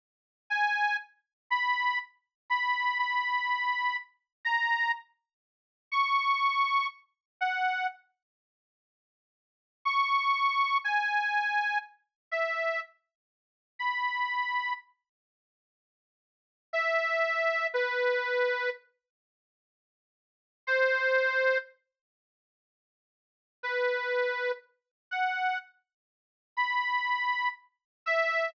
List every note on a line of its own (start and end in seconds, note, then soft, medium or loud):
0.50 0.97 G#5 medium
1.50 1.99 B5 medium
2.50 2.98 B5 medium
2.99 3.97 B5 medium
4.45 4.92 A#5 medium
5.92 6.87 C#6 medium
7.41 7.87 F#5 medium
9.85 10.78 C#6 medium
10.84 11.78 G#5 medium
12.31 12.80 E5 medium
13.79 14.73 B5 soft
16.73 17.67 E5 medium
17.74 18.70 B4 medium
20.67 21.58 C5 medium
23.63 24.52 B4 medium
25.11 25.58 F#5 soft
26.57 27.49 B5 medium
28.06 28.50 E5 medium